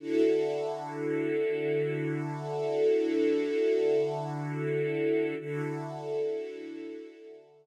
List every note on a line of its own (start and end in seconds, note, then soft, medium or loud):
0.00 5.34 D3 loud
0.00 5.34 E4 medium
0.00 5.34 F#4 medium
0.00 5.34 A4 medium
5.39 7.66 D3 medium
5.39 7.66 E4 loud
5.39 7.66 F#4 medium
5.39 7.66 A4 loud